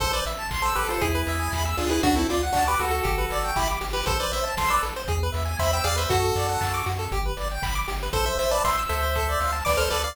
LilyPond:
<<
  \new Staff \with { instrumentName = "Lead 1 (square)" } { \time 4/4 \key a \minor \tempo 4 = 118 <a' c''>16 <b' d''>16 r8. <a' c''>16 <g' b'>16 <f' a'>16 <e' gis'>4. <d' f'>16 <e' gis'>16 | <d' fis'>16 <c' e'>16 eis'16 r16 <d' fis'>16 <g' b'>16 <fis' a'>4. <e' g'>16 r8 <g' b'>16 | <a' c''>16 <b' d''>16 <c'' e''>16 r16 <a' c''>16 <b' d''>16 r4. <c'' e''>16 g''16 <d'' f''>16 <c'' e''>16 | <fis' a'>4. r2 r8 |
<a' c''>16 <c'' e''>16 <c'' e''>16 <b' d''>16 <c'' e''>16 r16 <c'' e''>4. <b' d''>16 <a' c''>16 <b' d''>16 <d'' f''>16 | }
  \new Staff \with { instrumentName = "Lead 1 (square)" } { \time 4/4 \key a \minor a'16 c''16 e''16 a''16 c'''16 e'''16 a'16 c''16 gis'16 b'16 e''16 gis''16 b''16 e'''16 gis'16 b'16 | fis'16 a'16 d''16 fis''16 a''16 d'''16 fis'16 a'16 g'16 b'16 d''16 g''16 b''16 d'''16 g'16 b'16 | a'16 c''16 e''16 a''16 c'''16 e'''16 a'16 c''16 gis'16 b'16 e''16 gis''16 b''16 e'''16 gis'16 b'16 | fis'16 a'16 d''16 fis''16 a''16 d'''16 fis'16 a'16 g'16 b'16 d''16 g''16 b''16 d'''16 g'16 b'16 |
a'16 c''16 e''16 a''16 c'''16 e'''16 a'16 c''16 a'16 d''16 f''16 a''16 d'''16 f'''16 a'16 d''16 | }
  \new Staff \with { instrumentName = "Synth Bass 1" } { \clef bass \time 4/4 \key a \minor a,,8 a,,8 a,,8 a,,8 e,8 e,8 e,8 d,8 | d,8 d,8 d,8 d,8 g,,8 g,,8 g,,8 g,,8 | a,,8 a,,8 a,,8 a,,8 e,8 e,8 e,8 e,8 | fis,8 fis,8 fis,8 fis,8 g,,8 g,,8 g,,8 g,,8 |
a,,8 a,,8 a,,8 d,4 d,8 d,8 d,8 | }
  \new DrumStaff \with { instrumentName = "Drums" } \drummode { \time 4/4 <hh bd>8 hho8 <hc bd>8 hho8 <hh bd>8 hho8 <bd sn>8 <hho sn>8 | <hh bd>8 hho8 <hc bd>8 hho8 <hh bd>8 hho8 <hc bd>8 <hho sn>8 | <hh bd>8 hho8 <bd sn>8 hho8 <hh bd>8 hho8 <hc bd>8 <hho sn>8 | <hh bd>8 hho8 <hc bd>8 hho8 <hh bd>8 hho8 <hc bd>8 <hho sn>8 |
<hh bd>8 hho8 <bd sn>8 hho8 <hh bd>8 hho8 <bd sn>8 <hho sn>8 | }
>>